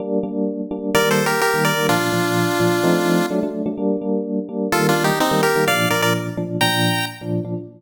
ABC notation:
X:1
M:4/4
L:1/16
Q:1/4=127
K:Bb
V:1 name="Lead 1 (square)"
z8 (3[Bd]2 [Ac]2 [GB]2 [GB]2 [Bd]2 | [DF]12 z4 | z8 (3[FA]2 [DF]2 [EG]2 [CE]2 [GB]2 | [df]2 [Bd] [Bd] z4 [gb]4 z4 |]
V:2 name="Electric Piano 1"
[G,B,D]2 [G,B,D]4 [G,B,D]2 [E,G,B,]5 [E,G,B,]2 [E,G,B,] | [B,,F,D]2 [B,,F,D]4 [B,,F,D]2 [F,A,CE]4 [^F,A,D] [F,A,D]2 [F,A,D] | [G,B,D]2 [G,B,D]4 [G,B,D]2 [E,G,B,]5 [E,G,B,]2 [E,G,B,] | [B,,F,D]2 [B,,F,D]4 [B,,F,D]2 [B,,F,D]5 [B,,F,D]2 [B,,F,D] |]